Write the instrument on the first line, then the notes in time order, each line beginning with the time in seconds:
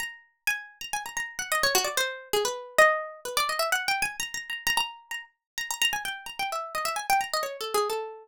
harpsichord
0.00 A#5
0.47 G#5
0.81 A#5
0.93 G#5
1.06 A#5
1.17 A#5
1.39 F#5
1.52 D#5
1.63 C#5
1.75 F#4
1.84 D5
1.97 C5
2.33 G#4
2.45 B4
2.78 D#5
3.25 B4
3.37 D5
3.49 D#5
3.59 E5
3.72 F#5
3.88 G5
4.02 G#5
4.20 A#5
4.34 A#5
4.50 A#5
4.67 A#5
4.77 A#5
5.11 A#5
5.58 A#5
5.71 A#5
5.82 A#5
5.93 G#5
6.05 G5
6.26 A#5
6.39 G5
6.52 E5
6.75 D#5
6.85 E5
6.96 G#5
7.10 G5
7.21 A#5
7.34 D#5
7.43 C#5
7.61 A4
7.74 G#4
7.90 A4